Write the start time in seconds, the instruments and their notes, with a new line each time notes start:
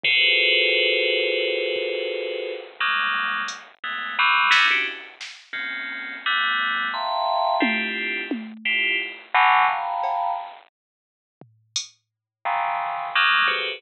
0.03 tubular bells F4 F#4 G#4 A4 B4 C5, floor tom
1.76 kick
2.80 tubular bells F#3 G3 G#3 A#3
3.48 closed hi-hat
3.84 tubular bells G#3 A3 B3
4.19 tubular bells E3 F#3 G3
4.51 tubular bells G3 A3 B3 C#4 D#4 E4, snare
4.70 tubular bells C#4 D4 E4 F#4 G4
5.21 snare
5.53 tubular bells A#3 C4 C#4, kick
6.26 tubular bells G3 A3 B3
6.94 tubular bells E5 F5 G5 A5 A#5 C6
7.60 tubular bells C4 D4 E4 F4 G4, high tom
8.31 high tom
8.65 tubular bells E4 F4 G4
9.34 tubular bells B2 C#3 D3 E3 F#3
9.69 tubular bells F5 G5 A5 A#5 B5
10.03 cowbell
11.41 floor tom
11.76 closed hi-hat
12.45 tubular bells A#2 C3 C#3 D#3 E3
13.15 tubular bells F#3 G3 G#3 A#3
13.48 tubular bells F#4 G4 G#4 A4 B4 C5, kick